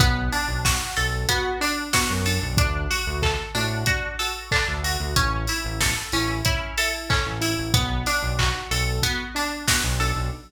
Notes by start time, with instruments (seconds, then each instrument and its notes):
0.00 synth bass 1 B1, acoustic grand piano B3, pizzicato strings B3, kick, closed hi-hat
0.32 acoustic grand piano D4, pizzicato strings D4, open hi-hat
0.48 synth bass 1 B1
0.65 pizzicato strings F#4, acoustic grand piano F#4, kick, snare
0.96 synth bass 1 B1, pizzicato strings A4, acoustic grand piano A4, open hi-hat
1.29 pizzicato strings B3, acoustic grand piano F#4, kick, closed hi-hat
1.60 acoustic grand piano D4, pizzicato strings D4, open hi-hat
1.93 acoustic grand piano B3, pizzicato strings F#4, kick, snare
2.10 synth bass 1 F#2
2.26 acoustic grand piano D4, pizzicato strings A4, open hi-hat
2.42 synth bass 1 B1
2.57 synth bass 1 D2, pizzicato strings D4, acoustic grand piano D4, kick, closed hi-hat
2.90 pizzicato strings F#4, acoustic grand piano F#4, open hi-hat
3.06 synth bass 1 D2
3.22 acoustic grand piano A4, pizzicato strings A4, kick, clap
3.55 synth bass 1 A2, pizzicato strings D4, acoustic grand piano F#4, open hi-hat
3.86 acoustic grand piano D4, pizzicato strings F#4, kick, closed hi-hat
4.19 acoustic grand piano F#4, pizzicato strings A4, open hi-hat
4.51 pizzicato strings D4, acoustic grand piano A4, kick, clap
4.68 synth bass 1 D2
4.83 acoustic grand piano F#4, pizzicato strings F#4, open hi-hat
5.00 synth bass 1 D2
5.16 synth bass 1 A1, pizzicato strings C#4, acoustic grand piano C#4, kick, closed hi-hat
5.47 pizzicato strings E4, acoustic grand piano E4, open hi-hat
5.65 synth bass 1 A1
5.80 acoustic grand piano A4, pizzicato strings A4, kick, snare
6.12 synth bass 1 A1, pizzicato strings C#4, acoustic grand piano E4, open hi-hat
6.45 acoustic grand piano C#4, pizzicato strings E4, kick, closed hi-hat
6.78 acoustic grand piano E4, pizzicato strings A4, open hi-hat
7.09 pizzicato strings C#4, acoustic grand piano A4, kick, clap
7.26 synth bass 1 A1
7.41 acoustic grand piano E4, pizzicato strings E4, open hi-hat
7.58 synth bass 1 A1
7.74 synth bass 1 B1, pizzicato strings B3, acoustic grand piano B3, kick, closed hi-hat
8.06 pizzicato strings D4, acoustic grand piano D4, open hi-hat
8.23 synth bass 1 B1
8.39 pizzicato strings F#4, acoustic grand piano F#4, kick, clap
8.71 synth bass 1 B1, acoustic grand piano A4, pizzicato strings A4, open hi-hat
9.02 pizzicato strings B3, acoustic grand piano F#4, kick, closed hi-hat
9.35 acoustic grand piano D4, pizzicato strings D4, open hi-hat
9.67 acoustic grand piano B3, pizzicato strings F#4, kick, snare
9.84 synth bass 1 B1
10.00 acoustic grand piano D4, pizzicato strings A4, open hi-hat
10.16 synth bass 1 B1